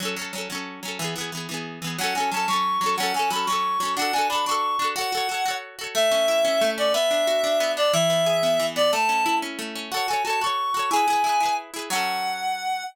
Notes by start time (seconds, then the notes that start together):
0.00 F#3 C#4
0.05 A4
0.16 F#3 C#4
0.21 A4
0.33 F#3 C#4
0.38 A4
0.50 F#3 C#4
0.55 A4
0.83 F#3 C#4
0.88 A4
0.99 E3 B3
1.04 G#4
1.16 E3 B3
1.21 G#4
1.32 E3 B3
1.37 G#4
1.49 E3 B3
1.54 G#4
1.82 E3 B3
1.87 G#4
1.98 F#3 C#4 F#5
2.04 A4
2.15 F#3 C#4 G#5
2.20 A4
2.31 F#3 C#4 A5
2.37 A4
2.48 F#3 C#4 C#6
2.53 A4
2.81 F#3 C#4
2.86 A4
2.97 F#3 C#4 F#5
3.03 A4
3.14 F#3 C#4 G#5
3.19 A4
3.30 F#3 C#4 B5
3.35 A4
3.46 F#3 C#4 C#6
3.52 A4
3.80 F#3 C#4
3.85 A4
3.97 D4 F#4 F#5
4.02 A4
4.13 D4 F#4 G#5
4.18 A4
4.29 D4 F#4 B5
4.35 A4
4.46 D4 F#4 C#6
4.51 A4
4.79 D4 F#4
4.84 A4
4.96 F#4 A4 F#5
5.01 C#5
5.12 F#4 A4
5.17 C#5
5.29 F#4 A4
5.34 C#5
5.46 F#4 A4
5.51 C#5
5.79 F#4 A4
5.84 C#5
5.95 A3 E5
6.11 C#4
6.28 E4
6.45 C#4
6.61 A3
6.78 C#4 D5
6.94 B3 E5
7.11 D4
7.27 F#4
7.44 D4
7.60 B3
7.77 D4 D5
7.93 E3 E5
8.10 B3
8.26 G#4
8.43 B3
8.60 E3
8.76 B3 D5
8.92 A3 A5
9.09 C#4
9.26 E4
9.42 C#4
9.59 A3
9.75 C#4
9.92 F#4 A4 F#5
9.97 C#5
10.08 F#4 A4 G#5
10.13 C#5
10.24 F#4 A4 A5
10.30 C#5
10.41 F#4 A4 C#6
10.46 C#5
10.74 F#4 A4
10.79 C#5
10.91 E4 G#4 G#5
10.96 B4
11.08 E4 G#4
11.13 B4
11.24 E4 G#4
11.29 B4
11.40 E4 G#4
11.45 B4
11.74 E4 G#4
11.79 B4
11.90 F#3 C#4 F#5
11.95 A4